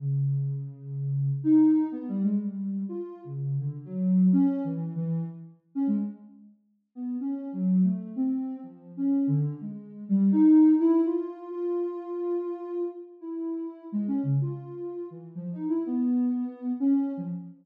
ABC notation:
X:1
M:3/4
L:1/16
Q:1/4=125
K:none
V:1 name="Ocarina"
_D,12 | _E4 (3B,2 G,2 _A,2 G,4 | F3 _D,3 =D,2 _G,4 | (3_D4 E,4 E,4 z4 |
_D _A, z8 B,2 | (3_D4 _G,4 A,4 C4 | (3F,4 _D4 =D,4 _A,4 | G,2 _E4 =E2 F4 |
F12 | z2 E6 (3_A,2 _D2 _D,2 | F6 E,2 (3F,2 _E2 =E2 | B,8 _D3 F, |]